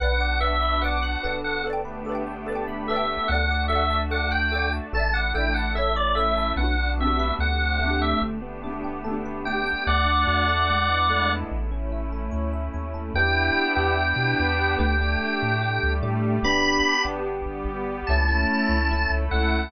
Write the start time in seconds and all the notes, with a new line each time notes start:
0.00 B1 B3 D4 F#4 B4 D5 F#5
0.05 F#5
0.20 D5
0.40 B4 D5 E5 F#5
0.47 F#5
0.62 B5
0.82 B4 D5 F#5 D6
0.88 F#5
1.02 F#6
1.23 G1 A4 B4 D5
1.29 F#5
1.44 F#5
1.64 A3 B3 D4 G4 A4 B4
1.70 D5 G5
1.85 B4
2.05 A4 D5
2.09 B4 D5
2.15 G5
2.27 G5
2.46 A4 B4 A5
2.52 D5 G5
2.68 B5
2.87 A4 B4 E5
2.93 D5 G5
3.28 D2 A3 D4 F#4 A4 D5 F#5
3.35 F#5
3.51 D5
3.68 A4 E5 F#5
3.72 D5 F#5
3.90 A5
4.11 A4 D5 F#5 D6
4.17 F#5
4.31 G5 F#6
4.52 A4 D5 D6
4.58 F#5
4.73 A5
4.92 A1 A3 D4 E4 A4 D5 A5
4.99 E5
5.14 D5 F#5
5.34 A1 A4 D5 E5 G5
5.40 E5
5.54 F#5 A5
5.74 A3 C#4 E4 A4 C#5 E5
5.81 E5
5.96 C#5 D5
6.15 A4 C#5 E5
6.22 E5
6.37 A5
6.56 B1 B3 D4 F#4 F#5
6.61 D4 F#4
6.79 D4
6.98 A3 C4 F#4 E5
7.04 D4 G4
7.19 B4
7.39 D2 A3 C4 D4 G4 F#5
7.61 C4
7.79 A3
7.85 B3 D4
7.91 G4
8.02 E5
8.21 G1 A3 B3 D4 G4
8.42 B3
8.63 A3 B3 D4
8.69 D4 G4
8.84 G4
9.04 A3 B3 A4
9.10 D4 G4
9.25 B4
9.45 A3 B3 D5 G5
9.51 D4 G4
9.66 G5
9.86 D2 A3 D4 F#4 D5 F#5
10.05 D4
10.27 E2 F#4
10.48 A4
10.68 G#3 B3 D4 E4
10.88 B3
11.10 A3
11.50 A1 A3 C#4 E4
11.71 C#4
11.92 E4
12.13 A4
12.31 D2 C#5
12.53 E5
12.74 D#2 C#5
12.94 A4
13.14 E2 B3 D4 E4 G4 G5
13.75 E2 B3 D4 E4 G4 G5
13.98 B3 D4 G4 B4
14.16 B2
14.40 E2
14.79 D2 A3 D4 G4 G5
15.00 A3 D4 G4
15.43 A2
15.61 G3 A3 D4 G4
15.83 D2
16.03 A2 A3 D4 G4
16.43 G1 B3 D4 G4 B5
17.05 G1 B3 D4 G4
17.27 G3 B3 G4
17.46 G1
17.66 G1
18.07 C#2 A3 C#4 E4 A5
18.28 A3 C#4 E4
18.69 C#2
18.91 A3 C#4 E4 A4
19.10 C#2
19.31 C#2 A3 C#4 E4 F#5